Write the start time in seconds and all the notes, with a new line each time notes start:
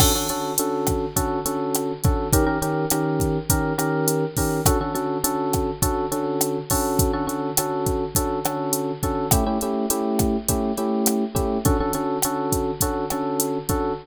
0.00 D3 C#4 F#4 A4, kick, cross-stick, crash
0.15 D3 C#4 F#4 A4
0.29 D3 C#4 F#4 A4, closed hi-hat
0.58 D3 C#4 F#4 A4, closed hi-hat
0.87 kick, cross-stick, closed hi-hat
1.16 D3 C#4 F#4 A4, kick, closed hi-hat
1.46 D3 C#4 F#4 A4, closed hi-hat
1.75 cross-stick, closed hi-hat
2.04 D3 C#4 F#4 A4, kick, closed hi-hat
2.33 D#3 C#4 G4 A#4, kick, closed hi-hat
2.46 D#3 C#4 G4 A#4
2.62 D#3 C#4 G4 A#4, closed hi-hat
2.90 D#3 C#4 G4 A#4, cross-stick, closed hi-hat
3.20 kick, closed hi-hat
3.50 D#3 C#4 G4 A#4, kick, closed hi-hat
3.78 D#3 C#4 G4 A#4, cross-stick, closed hi-hat
4.08 closed hi-hat
4.37 D#3 C#4 G4 A#4, kick, open hi-hat
4.66 D3 C#4 F#4 A4, kick, cross-stick, closed hi-hat
4.81 D3 C#4 F#4 A4
4.95 D3 C#4 F#4 A4, closed hi-hat
5.24 D3 C#4 F#4 A4, closed hi-hat
5.53 kick, cross-stick, closed hi-hat
5.82 D3 C#4 F#4 A4, kick, closed hi-hat
6.12 D3 C#4 F#4 A4, closed hi-hat
6.41 cross-stick, closed hi-hat
6.70 D3 C#4 F#4 A4, kick, open hi-hat
6.99 kick, closed hi-hat
7.13 D3 C#4 F#4 A4
7.27 D3 C#4 F#4 A4, closed hi-hat
7.57 D3 C#4 F#4 A4, cross-stick, closed hi-hat
7.86 kick, closed hi-hat
8.15 D3 C#4 F#4 A4, kick, closed hi-hat
8.45 D3 C#4 F#4 A4, cross-stick, closed hi-hat
8.73 closed hi-hat
9.03 D3 C#4 F#4 A4, kick, closed hi-hat
9.31 A3 C#4 E4 G4, kick, cross-stick, closed hi-hat
9.46 A3 C#4 E4 G4
9.61 A3 C#4 E4 G4, closed hi-hat
9.90 A3 C#4 E4 G4, closed hi-hat
10.19 kick, cross-stick, closed hi-hat
10.49 A3 C#4 E4 G4, kick, closed hi-hat
10.77 A3 C#4 E4 G4, closed hi-hat
11.06 cross-stick, closed hi-hat
11.35 A3 C#4 E4 G4, kick, closed hi-hat
11.65 D3 C#4 F#4 A4, kick, closed hi-hat
11.80 D3 C#4 F#4 A4
11.93 D3 C#4 F#4 A4, closed hi-hat
12.22 D3 C#4 F#4 A4, cross-stick, closed hi-hat
12.52 kick, closed hi-hat
12.81 D3 C#4 F#4 A4, kick, closed hi-hat
13.10 D3 C#4 F#4 A4, cross-stick, closed hi-hat
13.40 closed hi-hat
13.69 D3 C#4 F#4 A4, kick, closed hi-hat